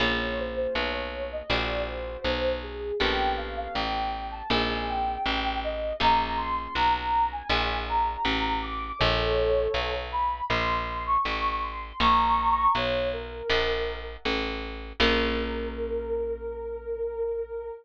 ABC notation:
X:1
M:4/4
L:1/16
Q:1/4=80
K:Bbdor
V:1 name="Ocarina"
d2 c c d d2 e =d2 c4 ^G2 | g2 f f g g2 =a _a2 g4 e2 | b2 c' c' b b2 a ^g2 b4 =d'2 | [=A^c]6 =b2 =c'3 d'3 c'2 |
[bd']4 d2 B6 z4 | B16 |]
V:2 name="Acoustic Guitar (steel)"
[B,DFA]8 [=D=E^F^G]8 | [=B,^CG=A]8 [=CEF_A]8 | [B,DFA]8 [=D=E^F^G]8 | z16 |
[dfab]8 [=d=e^f^g]8 | [B,DFA]16 |]
V:3 name="Electric Bass (finger)" clef=bass
B,,,4 =B,,,4 _B,,,4 =B,,,4 | B,,,4 =A,,,4 B,,,4 A,,,4 | B,,,4 =B,,,4 _B,,,4 =A,,,4 | B,,,4 =B,,,4 _B,,,4 =A,,,4 |
B,,,4 =B,,,4 _B,,,4 =A,,,4 | B,,,16 |]